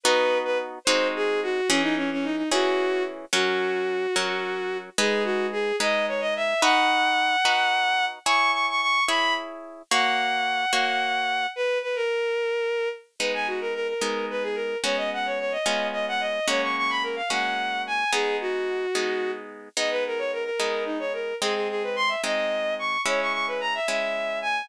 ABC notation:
X:1
M:6/8
L:1/16
Q:3/8=73
K:B
V:1 name="Violin"
B3 B z2 ^B2 G2 F2 | C D C C D D F4 z2 | F12 | G2 F2 G2 d2 c d e2 |
f12 | c'2 c' c' c'2 b2 z4 | f12 | B2 B A7 z2 |
[K:G#m] B g F A A A3 B G A2 | c d f c c d3 d f d2 | c c' c' b A ^e f4 g2 | G2 F8 z2 |
d B A c A A3 D c A2 | G G G B ^b e d4 c'2 | c c' c' B a e e4 g2 |]
V:2 name="Orchestral Harp"
[B,DF]6 [G,^B,DF]6 | [E,CG]6 [E,CG]6 | [F,CA]6 [F,CA]6 | [G,DB]6 [G,DB]6 |
[DFB]6 [DFB]6 | [EGc]6 [EGc]6 | [A,Fc]6 [A,Fc]6 | z12 |
[K:G#m] [G,B,D]6 [G,B,D]6 | [G,B,CF]6 [G,B,C^E]6 | [G,A,CF]6 [G,A,CF]6 | [G,B,D]6 [G,B,D]6 |
[G,B,D]6 [G,B,D]6 | [G,^B,D]6 [G,B,D]6 | [G,CE]6 [G,CE]6 |]